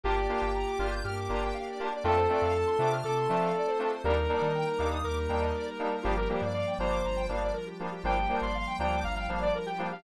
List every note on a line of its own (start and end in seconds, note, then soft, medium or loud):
0.03 0.27 G1 loud
0.03 1.02 A#3 medium
0.03 0.13 A#3 medium
0.03 1.02 D4 medium
0.03 0.13 D4 medium
0.03 1.02 F4 loud
0.03 0.13 F4 medium
0.03 1.02 G4 medium
0.03 0.87 G4 medium
0.03 0.13 G4 medium
0.03 0.15 A#4 medium
0.16 0.27 D5 medium
0.29 0.46 A#3 medium
0.29 0.46 D4 medium
0.29 0.46 F4 medium
0.29 0.46 G4 medium
0.29 0.41 F5 medium
0.41 0.64 G1 loud
0.41 0.52 G5 medium
0.55 0.66 A#5 medium
0.67 0.78 D6 medium
0.79 1.01 G1 loud
0.79 0.96 A#3 medium
0.79 0.96 D4 medium
0.79 0.96 F4 medium
0.79 0.96 G4 medium
0.79 0.90 F6 medium
0.91 1.02 G6 medium
1.04 1.27 G2 medium
1.04 2.03 A#3 medium
1.04 2.03 D4 loud
1.04 2.03 G4 medium
1.04 1.88 G4 medium
1.04 2.03 A#4 medium
1.04 1.15 F6 medium
1.16 1.28 D6 medium
1.29 1.52 G1 loud
1.29 1.47 A#3 medium
1.29 1.47 D4 medium
1.29 1.47 F4 medium
1.29 1.47 G4 medium
1.29 1.40 A#5 medium
1.43 1.54 G5 medium
1.54 1.65 F5 medium
1.67 1.78 D5 medium
1.79 1.88 A#3 medium
1.79 1.88 D4 medium
1.79 1.88 F4 medium
1.79 1.88 G4 medium
1.79 1.90 A#4 medium
1.92 2.03 D5 medium
2.04 2.27 F2 loud
2.04 2.13 A3 medium
2.04 3.02 A3 medium
2.04 2.13 C4 loud
2.04 3.02 C4 medium
2.04 2.13 D4 medium
2.04 3.04 D4 loud
2.04 2.13 F4 medium
2.04 3.02 F4 loud
2.04 2.90 A4 medium
2.04 2.16 A4 medium
2.17 2.28 C5 medium
2.29 2.46 A3 medium
2.29 2.46 C4 medium
2.29 2.46 D4 medium
2.29 2.46 F4 medium
2.29 2.42 D5 medium
2.42 2.64 F2 loud
2.42 2.54 F5 medium
2.54 2.65 A5 medium
2.67 2.78 C6 medium
2.79 3.01 C3 loud
2.79 2.96 A3 medium
2.79 2.96 C4 medium
2.79 2.96 D4 medium
2.79 2.96 F4 medium
2.79 2.92 D6 medium
2.93 3.04 F6 medium
3.03 3.27 C3 medium
3.03 4.02 A3 medium
3.03 4.02 C4 medium
3.03 4.02 F4 medium
3.03 4.02 A4 loud
3.03 3.92 A4 medium
3.03 3.14 D6 medium
3.17 3.28 C6 medium
3.29 3.52 F3 medium
3.29 3.47 A3 medium
3.29 3.47 C4 medium
3.29 3.47 D4 medium
3.29 3.47 F4 medium
3.29 3.40 A5 medium
3.40 3.52 F5 medium
3.55 3.66 D5 medium
3.67 3.78 C5 medium
3.79 3.88 A3 medium
3.79 3.88 C4 medium
3.79 3.88 D4 medium
3.79 3.88 F4 medium
3.79 3.91 A4 medium
3.91 4.02 C5 medium
4.04 4.27 D#2 loud
4.04 5.03 G3 medium
4.04 4.13 G3 medium
4.04 5.03 A#3 medium
4.04 4.13 A#3 medium
4.04 5.03 D4 loud
4.04 4.13 D4 medium
4.04 5.03 D#4 loud
4.04 4.13 D#4 medium
4.04 4.15 G4 medium
4.04 4.87 A#4 medium
4.17 4.28 A#4 medium
4.29 4.47 G3 medium
4.29 4.47 A#3 medium
4.29 4.47 D4 medium
4.29 4.47 D#4 medium
4.29 4.42 D5 medium
4.41 4.64 D#3 medium
4.41 4.52 D#5 medium
4.55 4.66 G5 medium
4.67 4.78 A#5 medium
4.78 5.01 D#2 medium
4.78 4.97 G3 medium
4.78 4.97 A#3 medium
4.78 4.97 D4 medium
4.78 4.97 D#4 medium
4.78 4.89 D6 medium
4.91 5.02 D#6 medium
5.03 5.27 D#2 loud
5.03 6.03 G3 medium
5.03 6.03 A#3 medium
5.03 6.03 D#4 medium
5.03 6.03 G4 medium
5.03 5.96 A#4 medium
5.03 5.15 D6 medium
5.17 5.28 A#5 medium
5.29 5.52 D#2 loud
5.29 5.47 G3 medium
5.29 5.47 A#3 medium
5.29 5.47 D4 medium
5.29 5.47 D#4 medium
5.29 5.40 G5 medium
5.41 5.52 D#5 medium
5.54 5.66 D5 medium
5.67 5.78 A#4 medium
5.78 5.88 G3 medium
5.78 5.88 A#3 medium
5.78 5.88 D4 medium
5.78 5.88 D#4 medium
5.78 5.89 G4 medium
5.92 6.04 A#4 medium
6.02 6.27 G1 loud
6.02 6.13 F3 loud
6.02 7.03 F3 loud
6.02 6.13 G3 medium
6.02 7.03 G3 medium
6.02 6.13 A#3 medium
6.02 7.04 A#3 loud
6.02 6.13 D4 medium
6.02 7.03 D4 medium
6.02 6.14 F4 medium
6.02 6.16 G4 medium
6.17 6.28 G4 medium
6.17 6.29 A#4 medium
6.29 6.47 F3 medium
6.29 6.47 G3 medium
6.29 6.47 A#3 medium
6.29 6.47 D4 medium
6.29 6.41 G4 medium
6.29 6.41 A#4 medium
6.42 6.64 G2 loud
6.42 6.53 D5 medium
6.53 6.74 D5 medium
6.53 6.65 F5 medium
6.67 6.78 G5 medium
6.79 7.01 G1 loud
6.79 6.97 F3 medium
6.79 6.97 G3 medium
6.79 6.97 A#3 medium
6.79 6.97 D4 medium
6.79 7.26 C5 medium
6.79 6.91 A#5 medium
6.90 7.02 D6 medium
7.04 7.27 G1 loud
7.04 8.03 F3 medium
7.04 8.03 G3 medium
7.04 8.03 D4 medium
7.04 8.03 F4 loud
7.04 7.16 A#5 medium
7.17 7.28 G5 medium
7.28 7.52 G1 loud
7.28 7.46 F3 medium
7.28 7.46 G3 medium
7.28 7.46 A#3 medium
7.28 7.46 D4 medium
7.28 7.39 F5 medium
7.41 7.52 D5 medium
7.53 7.65 A#4 medium
7.66 7.78 G4 medium
7.79 7.88 F3 medium
7.79 7.88 G3 medium
7.79 7.88 A#3 medium
7.79 7.88 D4 medium
7.79 7.90 F4 medium
7.92 8.03 G4 medium
8.03 8.26 G1 loud
8.03 9.02 F3 medium
8.03 8.13 F3 medium
8.03 9.02 G3 medium
8.03 8.13 G3 medium
8.03 9.02 A#3 medium
8.03 8.13 A#3 medium
8.03 9.02 D4 medium
8.03 8.13 D4 medium
8.03 8.15 F4 medium
8.03 8.36 G5 medium
8.17 8.28 G4 medium
8.29 8.46 F3 medium
8.29 8.46 G3 medium
8.29 8.46 A#3 medium
8.29 8.46 D4 medium
8.29 8.41 A#4 medium
8.41 8.64 G1 medium
8.41 8.53 D5 medium
8.41 8.76 C6 medium
8.55 8.66 F5 medium
8.67 8.78 G5 medium
8.79 9.01 D2 medium
8.79 8.97 F3 medium
8.79 8.97 G3 medium
8.79 8.97 A#3 medium
8.79 8.97 D4 medium
8.79 9.00 G5 medium
8.79 8.91 A#5 medium
8.93 9.04 D6 medium
9.03 9.26 G1 loud
9.03 10.03 F3 loud
9.03 10.03 G3 medium
9.03 10.03 D4 loud
9.03 10.03 F4 medium
9.03 9.15 F5 medium
9.03 9.14 A#5 medium
9.15 9.39 F5 medium
9.15 9.26 G5 medium
9.28 9.51 G1 medium
9.28 9.46 F3 medium
9.28 9.46 G3 medium
9.28 9.46 A#3 medium
9.28 9.46 D4 medium
9.28 9.41 F5 medium
9.40 9.52 D5 medium
9.40 9.54 D5 medium
9.55 9.66 A#4 medium
9.66 9.78 G4 medium
9.66 9.87 G5 medium
9.78 9.87 F3 medium
9.78 9.87 G3 medium
9.78 9.87 A#3 medium
9.78 9.87 D4 medium
9.78 9.89 F4 medium
9.92 10.03 G4 medium
9.92 10.03 F5 medium